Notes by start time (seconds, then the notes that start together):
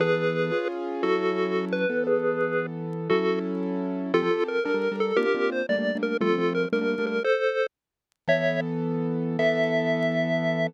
0.00 E3 B3 G#4 A4 B4
0.52 C#4 F4 G#4
1.03 F#3 C#4 E4 F#4 A4
1.73 B4
1.90 E3 B3 A4
2.07 G#4 B4
3.10 F#3 C#4 E4 F#4 A4
4.14 F3 C4 F4 G4 A4
4.22 F3 C4 G4 A4
4.31 F3 C4 G4 A4
4.48 A#4
4.65 G3 D4 A4 A#4
4.74 G3 D4 A4 A#4
4.91 G3 D4 A4 A#4
5.00 A4
5.17 A#3 C4 D4 F4 G4 A#4
5.26 A#3 C4 D4 F4
5.35 A#3 C4 D4 F4
5.52 C5
5.69 G3 A3 A#3 D4 D5
5.78 G3 A3 A#3 D4
5.95 G3 A3 A#3 D4
6.03 A#4
6.21 F3 G3 A3 C4 F4 A4
6.29 F3 G3 A3 C4
6.38 F3 G3 A3 C4
6.55 A#4
6.73 G3 A3 A#3 D4 A#4
6.81 G3 A3 A#3 D4
6.98 G3 A3 A#3 D4
7.07 A#4
7.24 A4 C5
8.28 E3 B3 A4 C#5 E5
9.39 E3 B3 A4 E5